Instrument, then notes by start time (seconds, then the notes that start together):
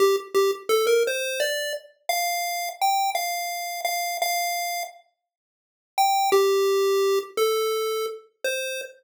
lead 1 (square)
0.00 G4
0.35 G4
0.69 A4
0.87 A#4
1.07 C5
1.40 D5
2.09 F5
2.81 G5
3.15 F5
3.85 F5
4.22 F5
5.98 G5
6.32 G4
7.37 A4
8.44 C5